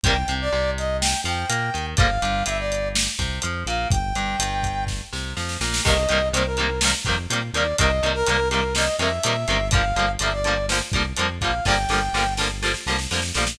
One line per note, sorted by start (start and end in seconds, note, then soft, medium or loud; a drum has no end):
0.04 0.24 C2 medium
0.04 0.14 C3 medium
0.04 0.14 D#3 medium
0.04 0.14 G3 medium
0.04 0.14 A#3 medium
0.04 0.34 G5 loud
0.04 kick loud
0.04 closed hi-hat medium
0.28 0.49 C2 medium
0.28 0.49 C3 medium
0.28 closed hi-hat medium
0.41 0.71 D5 loud
0.52 1.14 C2 medium
0.52 1.14 C3 medium
0.78 0.97 D#5 loud
0.78 closed hi-hat medium
1.01 1.21 G5 loud
1.01 snare loud
1.24 1.45 F2 medium
1.24 1.46 F3 medium
1.24 1.86 G5 medium
1.24 closed hi-hat medium
1.49 1.70 A#2 medium
1.49 1.70 A#3 medium
1.49 closed hi-hat medium
1.74 1.95 D#2 medium
1.74 1.94 D#3 medium
1.74 closed hi-hat medium
1.97 2.18 G1 medium
1.97 2.07 D3 medium
1.97 2.07 F3 medium
1.97 2.07 G3 medium
1.97 2.44 F5 loud
1.97 kick loud
1.97 closed hi-hat medium
2.01 2.07 A#3 medium
2.22 2.43 G1 medium
2.22 2.43 G2 medium
2.22 closed hi-hat medium
2.46 3.08 G1 medium
2.46 3.08 G2 medium
2.46 2.58 E5 loud
2.46 closed hi-hat medium
2.59 2.88 D5 medium
2.72 closed hi-hat medium
2.95 snare loud
3.19 3.39 C2 medium
3.19 3.39 C3 medium
3.19 kick medium
3.19 closed hi-hat medium
3.42 3.64 F2 medium
3.42 3.64 F3 medium
3.42 closed hi-hat medium
3.66 3.86 A#1 medium
3.66 3.88 A#2 medium
3.66 3.88 F5 medium
3.66 closed hi-hat medium
3.91 4.12 G1 medium
3.91 4.84 G5 loud
3.91 kick loud
3.91 closed hi-hat medium
4.14 4.35 G1 medium
4.14 4.36 G2 medium
4.14 closed hi-hat medium
4.39 5.01 G1 medium
4.39 5.02 G2 medium
4.39 closed hi-hat loud
4.63 kick medium
4.63 closed hi-hat medium
4.87 kick medium
4.87 snare medium
5.13 5.34 C2 medium
5.13 5.33 C3 medium
5.13 snare medium
5.36 5.57 F2 medium
5.36 5.57 F3 medium
5.36 snare medium
5.49 snare medium
5.60 5.81 A#1 medium
5.60 5.81 A#2 medium
5.60 snare medium
5.74 snare medium
5.84 6.06 C2 medium
5.84 5.94 C3 medium
5.84 5.94 D#3 medium
5.84 5.94 G3 medium
5.84 5.94 A#3 medium
5.84 6.29 D#5 loud
5.84 kick medium
5.84 crash medium
6.09 6.31 C2 medium
6.09 6.19 C3 medium
6.09 6.19 D#3 medium
6.09 6.19 G3 medium
6.09 6.19 A#3 medium
6.09 closed hi-hat medium
6.32 6.94 C2 medium
6.32 6.43 C3 medium
6.32 6.43 D#3 medium
6.32 6.43 G3 medium
6.32 6.44 C5 medium
6.32 closed hi-hat medium
6.36 6.43 A#3 medium
6.46 6.80 A#4 medium
6.57 6.67 C3 medium
6.57 6.67 D#3 medium
6.57 6.67 G3 medium
6.57 6.67 A#3 medium
6.57 closed hi-hat medium
6.81 6.91 C3 medium
6.81 6.91 D#3 medium
6.81 6.91 G3 medium
6.81 snare loud
6.85 6.91 A#3 medium
7.05 7.27 F2 medium
7.05 7.15 C3 medium
7.05 7.15 D#3 medium
7.05 7.15 G3 medium
7.05 kick medium
7.05 closed hi-hat medium
7.09 7.15 A#3 medium
7.30 7.51 A#2 medium
7.30 7.40 C3 medium
7.30 7.40 D#3 medium
7.30 7.40 G3 medium
7.30 7.40 A#3 medium
7.30 closed hi-hat medium
7.53 7.74 D#2 medium
7.53 7.64 C3 medium
7.53 7.64 D#3 medium
7.53 7.64 G3 medium
7.53 7.76 D5 medium
7.53 closed hi-hat medium
7.57 7.64 A#3 medium
7.78 8.00 C2 medium
7.78 7.88 C3 medium
7.78 7.88 D#3 medium
7.78 7.88 G3 medium
7.78 7.88 A#3 medium
7.78 8.10 D#5 loud
7.78 kick medium
7.78 closed hi-hat loud
8.03 8.23 C2 medium
8.03 8.13 C3 medium
8.03 8.13 D#3 medium
8.03 8.13 G3 medium
8.03 8.13 A#3 medium
8.03 closed hi-hat medium
8.14 8.49 A#4 loud
8.26 8.89 C2 medium
8.26 8.37 C3 medium
8.26 8.37 D#3 medium
8.26 8.37 G3 medium
8.26 8.37 A#3 medium
8.26 closed hi-hat medium
8.50 8.61 C3 medium
8.50 8.61 D#3 medium
8.50 8.61 G3 medium
8.50 8.61 A#3 medium
8.50 8.73 A#4 medium
8.50 closed hi-hat medium
8.75 8.85 C3 medium
8.75 8.85 D#3 medium
8.75 8.85 G3 medium
8.75 8.85 A#3 medium
8.75 8.96 D#5 loud
8.75 snare medium
8.99 9.19 F2 medium
8.99 9.09 C3 medium
8.99 9.09 D#3 medium
8.99 9.09 G3 medium
8.99 9.09 A#3 medium
8.99 9.68 E5 loud
8.99 closed hi-hat medium
9.23 9.45 A#2 medium
9.23 9.33 C3 medium
9.23 9.33 D#3 medium
9.23 9.33 G3 medium
9.23 9.33 A#3 medium
9.23 closed hi-hat loud
9.48 9.93 G1 medium
9.48 9.58 C3 medium
9.48 9.58 D#3 medium
9.48 9.58 G3 medium
9.48 9.58 A#3 medium
9.48 closed hi-hat medium
9.71 9.82 D3 medium
9.71 9.82 F3 medium
9.71 9.82 G3 medium
9.71 10.11 F5 loud
9.71 kick loud
9.71 closed hi-hat medium
9.75 9.82 A#3 medium
9.96 10.17 G1 medium
9.96 10.06 D3 medium
9.96 10.06 F3 medium
9.96 10.06 G3 medium
9.96 10.06 A#3 medium
9.96 closed hi-hat medium
10.19 10.82 G1 medium
10.19 10.30 D3 medium
10.19 10.30 F3 medium
10.19 10.30 G3 medium
10.19 10.32 E5 medium
10.19 closed hi-hat medium
10.24 10.30 A#3 medium
10.33 10.66 D5 medium
10.44 10.54 D3 medium
10.44 10.54 F3 medium
10.44 10.54 G3 medium
10.44 10.54 A#3 medium
10.44 closed hi-hat medium
10.69 10.79 D3 medium
10.69 10.79 F3 medium
10.69 10.79 G3 medium
10.69 10.79 A#3 medium
10.69 snare medium
10.92 11.13 C2 medium
10.92 11.03 D3 medium
10.92 11.03 F3 medium
10.92 11.03 G3 medium
10.92 kick medium
10.92 closed hi-hat medium
10.96 11.03 A#3 medium
11.16 11.39 F2 medium
11.16 11.27 D3 medium
11.16 11.27 F3 medium
11.16 11.27 G3 medium
11.16 11.27 A#3 medium
11.16 closed hi-hat medium
11.40 11.61 A#1 medium
11.40 11.51 D3 medium
11.40 11.51 F3 medium
11.40 11.51 G3 medium
11.40 11.64 F5 medium
11.40 kick medium
11.40 closed hi-hat medium
11.45 11.51 A#3 medium
11.65 11.86 G1 medium
11.65 11.75 D3 medium
11.65 11.75 F3 medium
11.65 11.75 G3 medium
11.65 11.75 A#3 medium
11.65 12.34 G5 loud
11.65 kick medium
11.65 snare medium
11.89 12.09 G1 medium
11.89 11.99 D3 medium
11.89 11.99 F3 medium
11.89 11.99 G3 medium
11.89 snare medium
11.93 11.99 A#3 medium
12.13 12.75 G1 medium
12.13 12.24 D3 medium
12.13 12.24 F3 medium
12.13 12.24 G3 medium
12.13 12.24 A#3 medium
12.13 snare medium
12.37 12.48 D3 medium
12.37 12.48 F3 medium
12.37 12.48 G3 medium
12.37 snare medium
12.41 12.48 A#3 medium
12.63 12.72 D3 medium
12.63 12.72 F3 medium
12.63 12.72 G3 medium
12.63 12.72 A#3 medium
12.63 snare medium
12.74 snare medium
12.86 13.07 C2 medium
12.86 12.96 D3 medium
12.86 12.96 F3 medium
12.86 12.96 G3 medium
12.86 12.96 A#3 medium
12.86 snare medium
12.98 snare medium
13.11 13.32 F2 medium
13.11 13.21 D3 medium
13.11 13.21 F3 medium
13.11 13.21 G3 medium
13.11 13.21 A#3 medium
13.11 snare medium
13.22 snare medium
13.34 13.56 A#1 medium
13.34 13.45 D3 medium
13.34 13.45 F3 medium
13.34 13.45 G3 medium
13.34 13.45 A#3 medium
13.34 snare medium
13.47 snare loud